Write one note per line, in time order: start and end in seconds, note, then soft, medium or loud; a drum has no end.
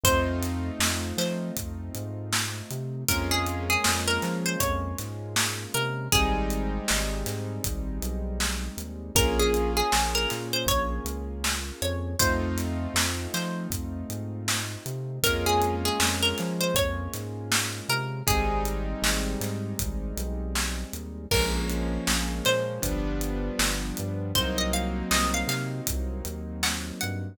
0.03 0.70 F2 medium
0.03 3.04 A3 medium
0.03 3.04 C4 medium
0.03 3.04 D#4 medium
0.03 3.04 F4 medium
0.03 1.09 C5 loud
0.03 kick loud
0.03 closed hi-hat loud
0.43 snare medium
0.43 closed hi-hat medium
0.79 1.13 F2 medium
0.79 snare loud
1.17 1.51 F3 medium
1.17 2.29 C5 medium
1.17 snare medium
1.17 closed hi-hat medium
1.57 1.90 F2 medium
1.57 kick loud
1.57 closed hi-hat loud
1.95 2.62 G#2 medium
1.95 closed hi-hat medium
2.33 snare loud
2.71 3.04 C3 medium
2.71 closed hi-hat medium
3.09 3.77 F2 medium
3.09 6.08 G#3 medium
3.09 6.08 A#3 medium
3.09 6.08 C#4 medium
3.09 6.08 F4 medium
3.09 3.30 A#4 loud
3.09 kick loud
3.09 closed hi-hat loud
3.31 3.60 G#4 loud
3.47 closed hi-hat medium
3.70 4.01 G#4 loud
3.84 4.19 F2 medium
3.84 snare loud
4.08 4.38 A#4 loud
4.22 4.56 F3 medium
4.22 snare medium
4.22 closed hi-hat medium
4.46 4.60 C5 loud
4.60 4.94 F2 medium
4.60 5.16 C#5 loud
4.60 kick loud
4.60 closed hi-hat loud
4.98 5.66 G#2 medium
4.98 snare soft
4.98 closed hi-hat medium
5.36 snare loud
5.74 6.08 C3 medium
5.74 6.08 A#4 loud
5.74 closed hi-hat medium
6.12 6.79 G#1 medium
6.12 9.12 G3 medium
6.12 9.12 G#3 medium
6.12 9.12 C4 medium
6.12 9.12 D#4 medium
6.12 7.10 G#4 loud
6.12 kick loud
6.12 closed hi-hat loud
6.50 closed hi-hat medium
6.88 7.24 G#1 medium
6.88 snare loud
7.26 7.59 G#2 medium
7.26 snare medium
7.26 closed hi-hat medium
7.64 7.99 G#1 medium
7.64 kick loud
7.64 closed hi-hat loud
8.02 8.69 B1 medium
8.02 closed hi-hat medium
8.40 snare loud
8.77 9.11 D#2 medium
8.77 closed hi-hat medium
9.15 9.82 A#1 medium
9.15 12.14 A#3 medium
9.15 12.14 C#4 medium
9.15 12.14 F4 medium
9.15 12.14 G#4 medium
9.15 9.38 A#4 loud
9.15 kick loud
9.15 closed hi-hat loud
9.39 9.73 G#4 loud
9.54 closed hi-hat medium
9.77 10.12 G#4 loud
9.92 10.26 A#1 medium
9.92 snare loud
10.15 10.47 A#4 loud
10.30 10.65 A#2 medium
10.30 snare medium
10.30 closed hi-hat medium
10.53 10.67 C5 loud
10.66 11.00 A#1 medium
10.66 11.25 C#5 loud
10.66 kick loud
10.66 closed hi-hat loud
11.05 11.72 C#2 medium
11.05 closed hi-hat medium
11.44 snare loud
11.82 12.15 F2 medium
11.82 12.16 C#5 medium
11.82 closed hi-hat medium
12.19 12.87 F2 medium
12.19 15.19 A3 medium
12.19 15.19 C4 medium
12.19 15.19 D#4 medium
12.19 15.19 F4 medium
12.19 13.24 C5 loud
12.19 kick loud
12.19 closed hi-hat loud
12.58 snare medium
12.58 closed hi-hat medium
12.94 13.27 F2 medium
12.94 snare loud
13.34 13.67 F3 medium
13.34 14.44 C5 medium
13.34 snare medium
13.34 closed hi-hat medium
13.70 14.04 F2 medium
13.70 kick loud
13.70 closed hi-hat loud
14.09 14.76 G#2 medium
14.09 closed hi-hat medium
14.48 snare loud
14.86 15.19 C3 medium
14.86 closed hi-hat medium
15.23 15.90 F2 medium
15.23 18.22 G#3 medium
15.23 18.22 A#3 medium
15.23 18.22 C#4 medium
15.23 18.22 F4 medium
15.23 15.46 A#4 loud
15.23 kick loud
15.23 closed hi-hat loud
15.46 15.75 G#4 loud
15.62 closed hi-hat medium
15.85 16.16 G#4 loud
16.00 16.33 F2 medium
16.00 snare loud
16.22 16.53 A#4 loud
16.38 16.73 F3 medium
16.38 snare medium
16.38 closed hi-hat medium
16.61 16.75 C5 loud
16.74 17.08 F2 medium
16.74 17.32 C#5 loud
16.74 kick loud
16.74 closed hi-hat loud
17.13 17.81 G#2 medium
17.13 snare soft
17.13 closed hi-hat medium
17.52 snare loud
17.89 18.22 C3 medium
17.89 18.23 A#4 loud
17.89 closed hi-hat medium
18.27 18.94 G#1 medium
18.27 21.26 G3 medium
18.27 21.26 G#3 medium
18.27 21.26 C4 medium
18.27 21.26 D#4 medium
18.27 19.25 G#4 loud
18.27 kick loud
18.27 closed hi-hat loud
18.65 closed hi-hat medium
19.02 19.36 G#1 medium
19.02 snare loud
19.41 19.74 G#2 medium
19.41 snare medium
19.41 closed hi-hat medium
19.79 20.13 G#1 medium
19.79 kick loud
19.79 closed hi-hat loud
20.17 20.84 B1 medium
20.17 closed hi-hat medium
20.55 snare loud
20.93 21.27 D#2 medium
20.93 closed hi-hat medium
21.31 21.98 A#1 medium
21.31 22.81 F3 medium
21.31 22.81 G#3 medium
21.31 22.81 A#3 medium
21.31 22.81 C#4 medium
21.31 22.32 A#4 loud
21.31 kick loud
21.31 crash loud
21.70 closed hi-hat medium
22.07 22.41 A#1 medium
22.07 snare loud
22.45 22.80 A#2 medium
22.45 23.58 C5 loud
22.45 snare medium
22.45 closed hi-hat medium
22.82 23.50 G1 medium
22.82 24.32 F3 medium
22.82 24.32 G3 medium
22.82 24.32 B3 medium
22.82 24.32 D4 medium
22.82 kick loud
22.82 closed hi-hat loud
23.21 closed hi-hat medium
23.59 23.92 G1 medium
23.59 snare loud
23.97 24.33 G2 medium
23.97 closed hi-hat medium
24.35 25.03 C2 medium
24.35 27.34 F#3 medium
24.35 27.34 A#3 medium
24.35 27.34 C4 medium
24.35 27.34 D#4 medium
24.35 24.57 C5 loud
24.35 kick loud
24.35 closed hi-hat loud
24.58 24.72 D#5 loud
24.73 25.06 F5 medium
24.73 closed hi-hat medium
25.11 25.44 C2 medium
25.11 25.33 D#5 loud
25.11 snare loud
25.34 25.48 F5 loud
25.47 25.81 C3 medium
25.47 25.71 F5 loud
25.47 snare medium
25.47 closed hi-hat medium
25.87 26.22 C2 medium
25.87 kick loud
25.87 closed hi-hat loud
26.25 26.92 D#2 medium
26.25 closed hi-hat medium
26.63 26.85 F#5 loud
26.63 snare loud
27.01 27.36 G2 medium
27.01 27.35 F#5 medium
27.01 closed hi-hat medium